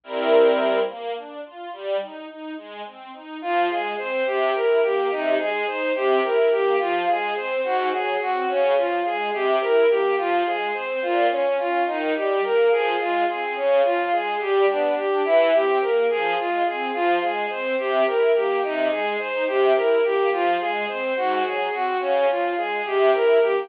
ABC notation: X:1
M:6/8
L:1/8
Q:3/8=71
K:Fm
V:1 name="Violin"
z6 | z6 | F A c G B G | E A c G B G |
F A c _G A G | D F A G B G | F A c F D F | E G B A F A |
D F A G =D G | =E G B A F A | F A c G B G | E A c G B G |
F A c _G A G | D F A G B G |]
V:2 name="String Ensemble 1"
[G,C=EB]3 B, =D F | G, E E A, C E | F, A, C C, =E B, | C, A, E C, =E B, |
F, A, C A,, _G, C | D, F, A, C, =E B, | F, A, C B,, D D | E, G, B, F, A, C |
D, F, A, G, =B, =D | =E, C B, F, A, C | F, A, C C, =E B, | C, A, E C, =E B, |
F, A, C A,, _G, C | D, F, A, C, =E B, |]